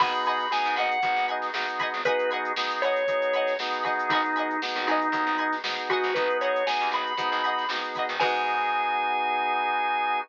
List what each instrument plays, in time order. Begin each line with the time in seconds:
0.00 electric bass (finger) G#1, drawbar organ B3 D#4 F#4 G#4 B5, pizzicato strings D#5 F#5 G#5 B5, kick, crash
0.15 closed hi-hat
0.25 pizzicato strings D#5 F#5 G#5 B5, drawbar organ B5, closed hi-hat
0.40 closed hi-hat
0.51 drawbar organ B3 D#4 F#4 G#4 G#5, snare
0.65 electric bass (finger) G#2, snare, closed hi-hat
0.76 electric bass (finger) G#1, pizzicato strings D#5 F#5 G#5 B5, drawbar organ F#5, closed hi-hat
0.91 closed hi-hat
1.02 electric bass (finger) G#1, drawbar organ B3 D#4 F#4 G#4, kick, closed hi-hat
1.16 electric bass (finger) G#1, snare, closed hi-hat
1.28 pizzicato strings D#5 F#5 G#5 B5, closed hi-hat
1.42 snare, closed hi-hat
1.54 electric bass (finger) G#1, drawbar organ B3 D#4 F#4 G#4, snare
1.69 closed hi-hat
1.79 pizzicato strings D#5 F#5 G#5 B5, kick, closed hi-hat
1.94 electric bass (finger) G#1, closed hi-hat
2.05 drawbar organ B3 D#4 F#4 G#4 B4, pizzicato strings F#5 G#5 B5, kick, closed hi-hat
2.09 pizzicato strings D#5
2.19 closed hi-hat
2.31 pizzicato strings D#5 F#5 G#5 B5, closed hi-hat
2.45 closed hi-hat
2.56 drawbar organ B3 D#4 F#4 G#4, snare
2.70 snare, closed hi-hat
2.82 drawbar organ C#5, pizzicato strings D#5 F#5 G#5 B5, snare, closed hi-hat
2.96 closed hi-hat
3.07 drawbar organ B3 D#4 F#4 G#4, kick, closed hi-hat
3.22 closed hi-hat
3.33 pizzicato strings D#5 F#5 G#5 B5, closed hi-hat
3.47 snare, closed hi-hat
3.59 drawbar organ B3 D#4 F#4 G#4, snare
3.73 closed hi-hat
3.84 drawbar organ B3 D#4 F#4 G#4, pizzicato strings D#5 F#5 G#5 B5, kick, closed hi-hat
3.99 closed hi-hat
4.10 electric bass (finger) G#1, drawbar organ D#4, pizzicato strings F#5 G#5 B5, kick, closed hi-hat
4.15 pizzicato strings D#5
4.24 snare, closed hi-hat
4.36 pizzicato strings D#5 F#5 G#5 B5, closed hi-hat
4.51 closed hi-hat
4.62 drawbar organ B3 D#4 F#4 G#4, snare
4.76 electric bass (finger) G#1, snare, closed hi-hat
4.87 electric bass (finger) G#1, drawbar organ D#4, pizzicato strings F#5 G#5 B5, closed hi-hat
4.91 pizzicato strings D#5
5.01 closed hi-hat
5.12 electric bass (finger) D#2, drawbar organ B3 D#4 F#4 G#4, kick, closed hi-hat
5.27 electric bass (finger) G#1, closed hi-hat
5.38 pizzicato strings D#5 F#5 G#5 B5, closed hi-hat
5.52 snare, closed hi-hat
5.64 electric bass (finger) G#1, drawbar organ B3 D#4 F#4 G#4, snare
5.78 closed hi-hat
5.89 drawbar organ F#4, pizzicato strings D#5 F#5 G#5 B5, kick, snare, closed hi-hat
6.04 electric bass (finger) G#1, closed hi-hat
6.14 electric bass (finger) G#1, drawbar organ B3 D#4 F#4 G#4 B4, kick, closed hi-hat
6.30 closed hi-hat
6.41 drawbar organ C#5, pizzicato strings D#5 F#5 G#5 B5, closed hi-hat
6.56 closed hi-hat
6.66 drawbar organ B3 D#4 F#4 G#4 G#5, snare
6.81 electric bass (finger) D#2, closed hi-hat
6.91 electric bass (finger) G#1, pizzicato strings D#5 F#5 G#5 B5, drawbar organ B5, closed hi-hat
7.07 closed hi-hat
7.17 electric bass (finger) G#2, drawbar organ B3 D#4 F#4 G#4, kick, closed hi-hat
7.32 electric bass (finger) G#1, closed hi-hat
7.44 pizzicato strings D#5 F#5 G#5 B5, closed hi-hat
7.58 snare, closed hi-hat
7.69 electric bass (finger) G#1, drawbar organ B3 D#4 F#4 G#4, snare
7.84 closed hi-hat
7.95 pizzicato strings F#5 G#5 B5, kick, closed hi-hat
7.99 pizzicato strings D#5
8.09 electric bass (finger) G#1, closed hi-hat
8.20 electric bass (finger) G#2, drawbar organ B3 D#4 F#4 G#4 G#5, pizzicato strings F#4 G#4 B4, kick, crash
8.24 pizzicato strings D#4